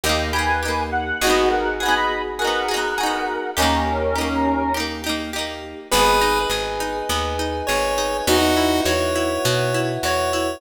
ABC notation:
X:1
M:4/4
L:1/16
Q:1/4=102
K:G#m
V:1 name="Lead 1 (square)"
z8 | z16 | z16 | [GB]4 z8 c4 |
[DF]4 c8 c4 |]
V:2 name="Lead 1 (square)"
[=Gd]2 [B^g]4 f2 | [Fd]2 [Af]2 [Bg] [db]2 z [Af]8 | [CA]10 z6 | z16 |
z16 |]
V:3 name="Electric Piano 1"
[A,D=G]8 | [B,DFG]16 | [A,D=G]16 | B,2 D2 G2 D2 B,2 D2 G2 D2 |
B,2 E2 F2 E2 B,2 E2 F2 E2 |]
V:4 name="Acoustic Guitar (steel)"
[A,D=G]2 [A,DG]2 [A,DG]4 | [B,DFG]4 [B,DFG]4 [B,DFG]2 [B,DFG]2 [B,DFG]4 | [A,D=G]4 [A,DG]4 [A,DG]2 [A,DG]2 [A,DG]4 | B,2 D2 G2 D2 B,2 D2 G2 D2 |
B,2 E2 F2 E2 B,2 E2 F2 E2 |]
V:5 name="Electric Bass (finger)" clef=bass
D,,8 | G,,,16 | D,,16 | G,,,4 G,,,4 D,,4 G,,,4 |
E,,4 E,,4 B,,4 E,,4 |]
V:6 name="Pad 5 (bowed)"
z8 | z16 | z16 | [Bdg]16 |
[Bef]16 |]